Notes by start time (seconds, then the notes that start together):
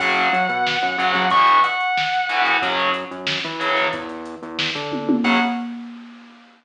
0.00 F#2 C#3 F#3 F#5, kick, crash
0.16 closed hi-hat
0.33 F#3, closed hi-hat
0.49 B2, closed hi-hat
0.67 snare
0.81 F#2, closed hi-hat
0.98 F#2 C#3 F#3, closed hi-hat
1.14 F#3, kick, snare, closed hi-hat
1.30 B2 E3 C#6, kick, closed hi-hat
1.47 closed hi-hat
1.64 F#5, closed hi-hat
1.80 closed hi-hat
1.97 snare
2.14 closed hi-hat
2.29 B2 E3, closed hi-hat
2.45 snare, closed hi-hat
2.62 F#2 C#3 F#3, kick, closed hi-hat
2.80 closed hi-hat
2.94 closed hi-hat
3.11 F#2, closed hi-hat
3.27 snare
3.45 E3, closed hi-hat
3.60 C#3 F#3, closed hi-hat
3.76 snare, closed hi-hat
3.93 E2, kick, closed hi-hat
4.09 closed hi-hat
4.25 closed hi-hat
4.42 E2, closed hi-hat
4.59 snare
4.75 D3, kick, closed hi-hat
4.92 kick, high tom
5.09 high tom
5.24 F#2 C#3 F#3 F#5, kick, crash